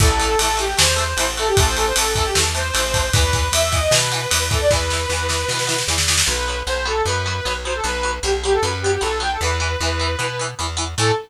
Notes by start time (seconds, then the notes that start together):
0.00 A1 E3 A3 A4, kick, crash
0.20 E3 A3, ride
0.39 A1 E3 A3 A4, ride
0.57 E3 A3 G4, ride
0.77 E2 E3 A3 C5, snare
0.96 E3 A3, ride
1.17 A1 E3 A3, ride
1.37 E3 A3 A4, ride
1.47 G4
1.57 A1 E3 A3 A4, kick, ride
1.66 C5
1.77 E3 A3 A4, ride
1.86 C5
1.96 A1 E3 A3 A4, ride
2.15 E3 A3 A4, kick, ride
2.25 G4
2.35 E2 E3 A3 A4, snare
2.55 E3 A3 C5, ride
2.74 A1 E3 A3, ride
2.94 E3 A3, kick, ride
3.13 E2 E3 B3 B4, kick, ride
3.33 E3 B3, kick, ride
3.52 E2 E3 B3 E5, ride
3.72 E3 B3 D#5, kick, ride
3.91 B2 E3 B3 B4, snare
4.12 E3 B3, ride
4.30 E2 E3 B3, ride
4.50 E3 B3 A4, kick, ride
4.61 D5
4.71 E2 E3 B3 B4, kick, snare
4.90 E3 B3, snare
5.09 E2 E3 B3, snare
5.29 E3 B3, snare
5.48 B2 E3 B3, snare
5.59 snare
5.67 E3 B3, snare
5.78 snare
5.88 E2 E3 B3, snare
5.98 snare
6.08 E3 B3, snare
6.17 snare
6.26 B1 F#3 B3 B4
6.48 F#3 B3
6.67 B1 F#3 B3 C5
6.85 F#3 B3 A4
7.05 F#2 F#3 B3 B4
7.26 F#3 B3
7.45 B1 F#3 B3
7.65 F#3 B3 C5
7.75 A4
7.84 B1 F#3 B3 B4
8.03 F#3 B3
8.23 B1 F#3 B3 G4
8.43 F#3 B3 G4
8.53 A4
8.62 F#2 F#3 B3 B4
8.82 F#3 B3 G4
8.92 G4
9.01 B1 F#3 B3 A4
9.20 F#3 B3 G5
9.31 A4
9.41 E2 E3 B3 B4
9.60 E3 B3
9.80 E2 E3 B3
9.99 E3 B3
10.19 B2 E3 B3
10.39 E3 B3
10.59 E2 E3 B3
10.77 E3 B3
10.98 A2 E3 A3 A4